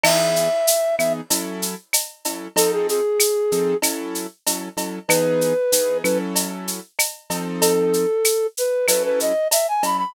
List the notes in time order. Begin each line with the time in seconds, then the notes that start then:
0.03 E3 B3 D#4 G#4 E5, crash, cowbell, claves
0.36 shaker
0.67 shaker
0.98 E3 B3 D#4 G#4 E5, claves, shaker
1.30 F#3 C#4 E4 A4, cowbell, shaker
1.62 shaker
1.93 cowbell, claves, shaker
2.25 F#3 C#4 E4 A4, cowbell, shaker
2.56 F3 C4 D#4 A4, cowbell, shaker
2.72 G#4
2.89 G#4, shaker
3.20 claves, shaker
3.52 F3 C4 D#4 A4, shaker
3.82 F#3 C#4 E4 A4, cowbell, claves, shaker
4.15 shaker
4.46 F#3 C#4 E4 A4, cowbell, shaker
4.77 F#3 C#4 E4 A4, cowbell, shaker
5.08 E3 B3 D#4 G#4 B4, cowbell, claves, shaker
5.41 shaker
5.72 E3 B3 D#4 G#4, shaker
6.03 F#3 C#4 E4 A4 B4, claves, shaker
6.35 cowbell, shaker
6.68 shaker
6.99 cowbell, claves, shaker
7.30 F3 C4 D#4 A4, cowbell, shaker
7.61 A4, cowbell, shaker
7.93 shaker
8.24 claves, shaker
8.57 B4, shaker
8.88 F#3 C#4 E4 A4 B4, cowbell, claves, shaker
9.05 B4
9.20 D#5, shaker
9.51 E5, cowbell, shaker
9.68 G#5
9.83 F#3 C#4 E4 A4 B5, cowbell, shaker
9.98 B5